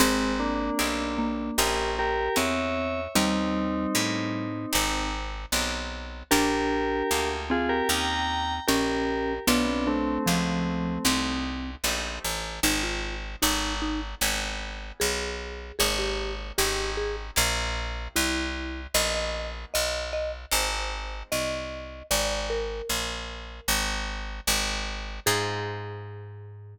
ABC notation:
X:1
M:4/4
L:1/16
Q:1/4=76
K:Ablyd
V:1 name="Tubular Bells"
[A,C]2 [B,D]6 [GB]2 [GB]2 [_d_f]4 | [CE]10 z6 | [GB]6 [FA] [GB] [gb]4 [GB]4 | [=B,D]2 [=A,C]8 z6 |
z16 | z16 | z16 | z16 |
z16 |]
V:2 name="Marimba"
C6 B,6 C4 | G,8 z8 | D6 C6 _D4 | =B, C D2 F,4 C4 z4 |
E F2 z ^D2 D z5 A4 | A G2 z G2 A z5 =E4 | e e2 z e2 e z5 e4 | d2 B8 z6 |
A16 |]
V:3 name="Orchestral Harp"
[CEGA]4 [CEGA]4 [B,_D_FA]4 [B,DFA]4 | [B,_DEG]4 [B,DEG]4 [CEGA]4 [CEGA]4 | [B,DFG]4 [B,DFG]4 [B,_DEG]4 [B,DEG]4 | [=A,=B,FG]4 [A,B,FG]4 [A,CEG]4 [A,CEG]4 |
[CEFA]4 [=B,^D^F=A]4 [_C_D_F_A]8 | [B,_DEA]4 [CDEG]4 [B,C=EG]8 | [B,_CE_G]8 [A,=CEF]8 | z16 |
[CEFA]16 |]
V:4 name="Electric Bass (finger)" clef=bass
A,,,4 =B,,,4 _B,,,4 _F,,4 | E,,4 =A,,4 _A,,,4 =B,,,4 | B,,,4 D,,4 E,,4 B,,,4 | =B,,,4 _D,,4 C,,4 _B,,,2 =A,,,2 |
A,,,4 A,,,4 A,,,4 _C,,4 | A,,,4 A,,,4 B,,,4 C,,4 | B,,,4 _C,,4 A,,,4 =C,,4 | A,,,4 B,,,4 A,,,4 A,,,4 |
A,,16 |]